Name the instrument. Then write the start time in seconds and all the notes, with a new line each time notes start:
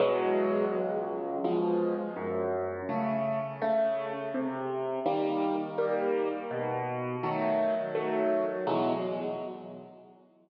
acoustic grand piano
0.00 E2 B2 F#3 G#3
0.72 C#2
1.44 B2 F3 G#3
2.16 F#2
2.89 C#3 A3
3.62 C#3 A3
4.34 C3
5.06 D#3 G3 A#3
5.78 D#3 G3 A#3
6.51 B2
7.23 D#3 F#3 A3
7.95 D#3 F#3 A3
8.67 E2 B2 F#3 G#3